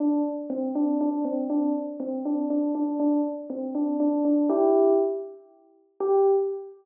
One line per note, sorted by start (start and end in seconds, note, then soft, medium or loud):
0.00 0.22 D4 medium
0.50 0.72 C4 loud
0.75 0.97 D4 medium
1.01 1.24 D4 medium
1.25 1.48 C4 medium
1.50 1.73 D4 medium
2.00 2.23 C4 medium
2.25 2.46 D4 medium
2.50 2.73 D4 medium
2.75 2.99 D4 medium
3.00 3.21 D4 medium
3.50 3.74 C4 medium
3.75 3.96 D4 medium
4.00 4.23 D4 medium
4.25 4.49 D4 medium
4.49 4.93 E4 medium
4.49 4.93 G4 medium
6.00 6.27 G4 loud